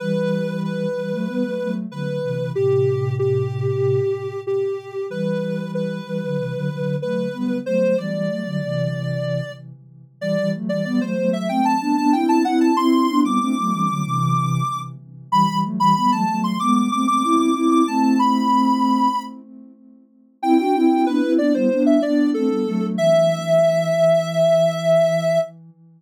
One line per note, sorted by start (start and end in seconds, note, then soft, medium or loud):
0.00 0.86 E3 medium
0.00 0.86 G3 loud
0.00 0.61 B4 medium
0.64 1.73 B4 medium
0.97 1.12 E3 medium
0.97 1.12 G3 medium
1.13 1.28 F#3 medium
1.13 1.28 A3 loud
1.28 1.43 G3 medium
1.28 1.43 B3 medium
1.44 1.59 F#3 medium
1.44 1.59 A3 medium
1.60 1.86 F#3 medium
1.60 1.86 A3 medium
1.91 2.18 D3 medium
1.91 2.18 F#3 medium
1.91 2.51 B4 medium
2.23 2.51 C3 medium
2.23 2.51 E3 medium
2.55 4.01 A2 medium
2.55 4.01 C3 medium
2.55 3.15 G4 medium
3.19 4.41 G4 medium
4.47 5.06 G4 medium
5.09 6.00 E3 medium
5.09 6.00 G3 medium
5.09 5.71 B4 medium
5.74 6.96 B4 medium
6.07 6.22 E3 medium
6.07 6.22 G3 medium
6.22 6.37 D3 medium
6.22 6.37 F#3 medium
6.38 6.53 C3 medium
6.38 6.53 E3 medium
6.54 6.69 D3 medium
6.54 6.69 F#3 medium
6.70 6.96 D3 medium
6.70 6.96 F#3 medium
7.02 7.28 F#3 medium
7.02 7.28 A3 medium
7.02 7.58 B4 medium
7.33 7.59 G3 medium
7.33 7.59 B3 medium
7.66 7.95 F#3 medium
7.66 7.95 A3 medium
7.66 7.97 C5 medium
7.98 8.29 E3 medium
7.98 8.29 G3 medium
7.98 9.52 D5 medium
8.29 8.44 F#3 medium
8.29 8.44 A3 medium
8.45 8.61 D3 medium
8.45 8.61 F#3 medium
8.62 9.41 C3 medium
8.62 9.41 E3 medium
10.21 10.36 E3 loud
10.21 10.36 G3 loud
10.21 10.51 D5 medium
10.38 10.54 E3 medium
10.38 10.54 G3 loud
10.54 10.70 F#3 medium
10.54 10.70 A3 medium
10.69 10.85 E3 medium
10.69 10.84 G3 loud
10.69 10.84 D5 medium
10.84 11.00 G3 loud
10.84 11.00 B3 loud
10.84 11.00 D5 medium
11.01 11.17 F#3 loud
11.01 11.17 A3 loud
11.01 11.30 C5 medium
11.18 11.48 F#3 medium
11.18 11.48 A3 loud
11.33 11.48 E5 medium
11.49 11.75 A3 medium
11.49 11.75 C4 loud
11.49 11.64 G5 medium
11.65 11.80 A5 medium
11.81 11.96 B3 medium
11.81 11.96 D4 loud
11.81 11.96 A5 medium
11.97 12.13 B3 medium
11.97 12.13 D4 loud
11.97 12.12 A5 medium
12.13 12.43 C4 medium
12.13 12.43 E4 loud
12.13 12.28 G5 medium
12.29 12.44 A5 medium
12.44 12.72 C4 medium
12.44 12.72 E4 loud
12.44 12.60 F#5 medium
12.61 12.76 A5 medium
12.76 13.07 C4 loud
12.76 13.07 E4 loud
12.76 13.20 C6 medium
13.09 13.23 B3 medium
13.09 13.24 D4 loud
13.24 13.39 G3 loud
13.24 13.39 B3 loud
13.24 14.80 D6 medium
13.40 13.56 A3 loud
13.40 13.56 C4 loud
13.57 13.72 F#3 medium
13.57 13.72 A3 loud
13.72 13.88 E3 loud
13.72 13.88 G3 loud
13.88 14.03 D3 medium
13.88 14.03 F#3 medium
14.04 14.62 C3 loud
14.04 14.62 E3 loud
15.32 15.47 E3 loud
15.32 15.47 G3 loud
15.32 15.59 B5 medium
15.48 15.63 E3 medium
15.48 15.63 G3 loud
15.64 15.79 F#3 medium
15.64 15.79 A3 loud
15.79 15.94 E3 loud
15.79 15.94 G3 loud
15.79 15.95 B5 medium
15.96 16.12 G3 medium
15.96 16.12 B3 loud
15.96 16.11 B5 medium
16.12 16.26 F#3 medium
16.12 16.26 A3 loud
16.12 16.41 A5 medium
16.27 16.58 F#3 medium
16.27 16.58 A3 loud
16.44 16.59 C6 medium
16.60 16.88 G#3 loud
16.60 16.88 B3 loud
16.60 16.75 D6 medium
16.76 16.91 D6 medium
16.91 17.07 A3 medium
16.91 17.07 C4 medium
16.91 17.07 D6 medium
17.07 17.23 A3 medium
17.07 17.23 C4 medium
17.07 17.23 D6 medium
17.23 17.51 C4 medium
17.23 17.51 E4 loud
17.23 17.39 D6 medium
17.39 17.55 D6 medium
17.55 17.83 C4 loud
17.55 17.83 E4 loud
17.55 17.70 D6 medium
17.71 17.86 D6 medium
17.87 19.08 A3 loud
17.87 19.08 C4 loud
17.87 18.02 A5 medium
18.03 18.18 A5 medium
18.19 19.23 B5 medium
20.42 20.57 C4 loud
20.42 20.57 E4 loud
20.42 20.58 G5 medium
20.59 20.74 D4 medium
20.59 20.74 F#4 medium
20.59 20.74 G5 medium
20.74 21.05 C4 medium
20.74 21.05 E4 loud
20.74 21.05 G5 medium
21.06 21.22 B3 medium
21.06 21.22 D4 medium
21.06 21.33 B4 medium
21.22 21.38 C4 medium
21.22 21.38 E4 loud
21.38 21.53 B3 medium
21.38 21.53 D4 loud
21.38 21.53 D5 medium
21.54 21.69 G3 medium
21.54 21.69 B3 loud
21.54 21.83 C5 medium
21.71 21.98 B3 loud
21.71 21.98 D4 loud
21.86 22.01 E5 medium
22.02 22.33 B3 medium
22.02 22.33 D4 loud
22.02 22.30 D5 medium
22.34 22.49 A3 medium
22.34 22.49 C4 loud
22.34 22.86 A4 medium
22.49 22.64 G3 medium
22.49 22.64 B3 medium
22.66 22.96 F#3 medium
22.66 22.96 A3 loud
22.97 25.38 E3 loud
22.97 25.39 E5 loud